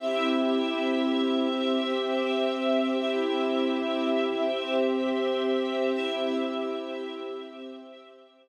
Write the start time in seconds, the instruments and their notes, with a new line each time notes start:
0.00 string ensemble 1 C4 G4 E5, pad 2 (warm) C4 E4 G4
1.48 pad 2 (warm) C4 G4 C5
2.96 pad 2 (warm) C4 E4 G4, string ensemble 1 C4 G4 E5
4.44 pad 2 (warm) C4 G4 C5
5.93 string ensemble 1 C4 G4 E5, pad 2 (warm) C4 E4 G4
7.41 pad 2 (warm) C4 G4 C5